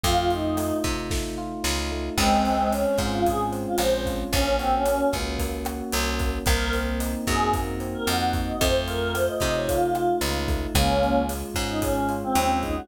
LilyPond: <<
  \new Staff \with { instrumentName = "Choir Aahs" } { \time 4/4 \key des \major \tempo 4 = 112 f'8 ees'4 r2 r8 | <aes c'>4 des'8 r16 f'16 aes'16 r8 f'16 c''8 r8 | des'8 c'16 des'8. r2 r8 | bes'8 r4 aes'8 r8. bes'16 ges''8 r16 ees''16 |
c''16 r16 bes'8 c''16 ees''16 ees''16 des''16 f'4 r4 | <bes des'>4 r8. ees'16 des'8 r16 c'8. ees'16 ges'16 | }
  \new Staff \with { instrumentName = "Electric Piano 1" } { \time 4/4 \key des \major a8 f'8 a8 ees'8 a8 f'8 ees'8 a8 | aes8 c'8 des'8 f'8 aes8 c'8 des'8 f'8 | bes8 ges'8 bes8 des'8 bes8 ges'8 des'8 bes8 | bes8 c'8 ees'8 ges'8 bes8 c'8 ees'8 ges'8 |
a8 f'8 a8 ees'8 a8 f'8 ees'8 a8 | aes8 f'8 aes8 des'8 aes8 f'8 des'8 aes8 | }
  \new Staff \with { instrumentName = "Electric Bass (finger)" } { \clef bass \time 4/4 \key des \major f,4. c4. des,4 | des,4. aes,4. bes,,4 | bes,,4. des,4. c,4 | c,4. ges,4. f,4 |
f,4. c4. des,4 | des,4. aes,4. ees,4 | }
  \new DrumStaff \with { instrumentName = "Drums" } \drummode { \time 4/4 <hh bd>8 hh8 <hh ss>8 <hh bd sn>8 <bd sn>4 sn4 | <cymc bd ss>8 hh8 hh8 <hh bd sn>8 <hh bd>8 hh8 <hh ss>8 <hh bd>8 | <hh bd>8 hh8 <hh ss>8 <hh bd sn>8 <hh bd>8 <hh ss>8 hh8 <hh bd>8 | <hh bd ss>8 hh8 hh8 <hh bd sn>8 <hh bd>8 hh8 <hh ss>8 <hh bd>8 |
<hh bd>8 hh8 <hh ss>8 <hh bd sn>8 <hh bd>8 <hh ss>8 hh8 <hh bd>8 | <hh bd ss>8 hh8 hh8 <hh bd sn>8 <hh bd>8 hh8 <hh ss>8 <hh bd>8 | }
>>